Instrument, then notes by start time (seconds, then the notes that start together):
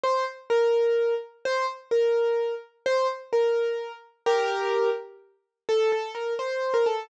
acoustic grand piano
0.03 C5
0.50 A#4
1.45 C5
1.91 A#4
2.86 C5
3.33 A#4
4.26 G4 A#4
5.69 A4
5.92 A4
6.15 A#4
6.39 C5
6.74 A#4
6.86 A4